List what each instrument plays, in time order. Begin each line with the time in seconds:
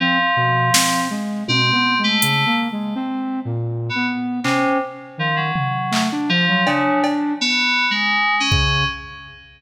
0.00 electric piano 2 F3, flute C4
0.36 flute B2
0.74 flute C4, snare
1.10 flute G#3
1.48 flute B2, electric piano 2 C4, high tom
1.72 flute B3
1.99 flute G#3
2.04 electric piano 2 A3
2.22 flute C#3, closed hi-hat
2.46 flute A#3
2.72 flute G#3
2.95 flute C4
3.45 flute A#2
3.89 electric piano 2 B3
3.95 flute B3
4.44 electric piano 2 C3, flute C#4, clap
5.18 flute D#3, electric piano 2 F3
5.36 electric piano 2 F#3
5.56 floor tom
5.91 flute A3, clap
6.12 flute D4
6.29 flute F3, electric piano 2 F3
6.48 flute F#3
6.66 electric piano 2 C#3, flute D4, cowbell
7.04 cowbell
7.41 electric piano 2 B3
7.91 electric piano 2 G#3
8.40 electric piano 2 C#4
8.51 flute C#3, kick